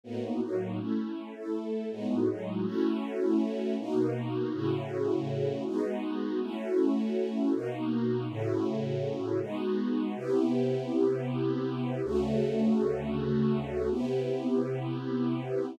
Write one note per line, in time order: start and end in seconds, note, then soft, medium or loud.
0.04 0.41 A2 medium
0.04 0.41 A#3 medium
0.04 0.41 B3 medium
0.04 0.41 D#4 medium
0.04 0.41 F#4 medium
0.42 0.79 A2 medium
0.42 0.79 F#3 medium
0.42 0.79 A#3 medium
0.42 0.79 D#4 medium
0.42 0.79 F#4 medium
0.79 1.34 A3 medium
0.79 1.35 C#4 medium
0.79 1.34 E4 medium
1.35 1.90 A3 medium
1.35 1.90 E4 medium
1.35 1.90 A4 medium
1.91 2.28 A2 medium
1.91 2.28 G#3 medium
1.91 2.28 B3 medium
1.91 2.28 D#4 medium
1.91 2.28 F#4 medium
2.28 2.65 A2 medium
2.28 2.65 F#3 medium
2.28 2.65 G#3 medium
2.28 2.65 D#4 medium
2.28 2.65 F#4 medium
2.65 3.77 A3 medium
2.65 3.77 C#4 medium
2.65 3.77 E4 medium
2.65 3.77 F#4 medium
3.79 4.53 B2 medium
3.79 4.53 A#3 medium
3.79 4.53 D#4 medium
3.79 4.52 F#4 medium
4.53 5.64 A2 medium
4.53 5.64 C#3 medium
4.53 5.64 E4 medium
4.53 5.64 F#4 medium
5.66 6.40 G#3 medium
5.66 6.40 B3 medium
5.66 6.40 D#4 medium
5.66 6.40 F#4 medium
6.41 7.53 A3 medium
6.41 7.53 C#4 medium
6.41 7.53 E4 medium
6.41 7.53 F#4 medium
7.53 8.28 B2 medium
7.53 8.28 A#3 medium
7.53 8.28 D#4 medium
7.53 8.28 F#4 medium
8.28 9.40 A2 loud
8.28 9.40 C#3 medium
8.28 9.40 E4 medium
8.28 9.40 F#4 medium
9.41 10.15 G#3 medium
9.41 10.15 B3 medium
9.41 10.15 D#4 medium
9.41 10.15 F#4 medium
10.16 12.01 C3 medium
10.16 12.01 B3 medium
10.16 12.01 E4 medium
10.16 12.01 G4 medium
12.04 13.89 D2 medium
12.04 13.89 C#3 medium
12.04 13.89 A3 loud
12.04 13.89 F#4 medium
13.91 15.76 C3 medium
13.91 15.76 B3 medium
13.91 15.76 E4 medium
13.91 15.76 G4 medium